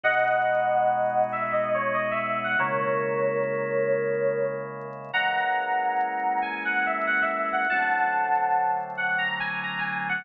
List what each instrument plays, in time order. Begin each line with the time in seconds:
0.03 drawbar organ B2 G#3 D#4 F#4, electric piano 2 D#5 F#5
1.32 electric piano 2 E5
1.53 electric piano 2 D#5
1.74 electric piano 2 C#5
1.94 electric piano 2 D#5
2.11 electric piano 2 E5
2.44 electric piano 2 F#5
2.59 drawbar organ C#3 G#3 A#3 E4, electric piano 2 A#4 C#5
5.13 drawbar organ E3 G#3 A#3 C#4, electric piano 2 F#5 A#5
6.42 electric piano 2 G#5
6.65 electric piano 2 F#5
6.86 electric piano 2 E5
7.07 electric piano 2 F#5
7.22 electric piano 2 E5
7.52 electric piano 2 F#5
7.70 drawbar organ D3 F#3 A3 C4, electric piano 2 F#5 A5
8.97 electric piano 2 F#5
9.18 electric piano 2 A#5
9.40 electric piano 2 G#5
9.63 electric piano 2 A#5
9.79 electric piano 2 G#5
10.09 electric piano 2 F#5